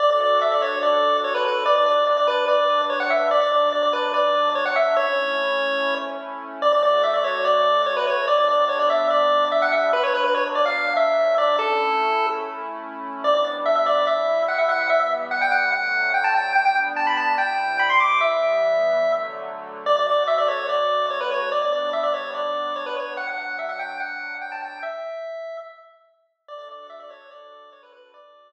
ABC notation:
X:1
M:4/4
L:1/16
Q:1/4=145
K:D
V:1 name="Lead 1 (square)"
d d d2 e d c2 d4 c B B2 | d d d2 d d B2 d4 c f e2 | d d d2 d d B2 d4 c f e2 | c10 z6 |
d d d2 e d c2 d4 c B c2 | d d d2 c d e2 d4 e f e2 | B c B B c z d =f3 e4 d2 | A8 z8 |
[K:G] d d z2 e e d2 e4 f e f2 | e e z2 f g f2 f4 g a g2 | g g z2 a b a2 g4 b c' d'2 | e10 z6 |
[K:D] d d d2 e d c2 d4 c B c2 | d d d2 e d c2 d4 c B c2 | f f f2 e f g2 f4 g a g2 | e8 z8 |
d d d2 e d c2 d4 c B B2 | d8 z8 |]
V:2 name="Pad 2 (warm)"
[DFA]16 | [G,DB]16 | [B,,F,D]16 | [A,CE]16 |
[D,A,F]16 | [G,B,D]16 | [B,,F,D]16 | [A,CE]16 |
[K:G] [G,B,D]8 [C,G,E]8 | [E,G,B,]8 [D,F,A,]8 | [G,B,D]8 [C,G,E]8 | [E,G,B,]8 [D,F,A,]8 |
[K:D] [D,A,F]16 | [G,B,D]16 | [B,,F,D]16 | z16 |
[DFA]16 | [DFA]16 |]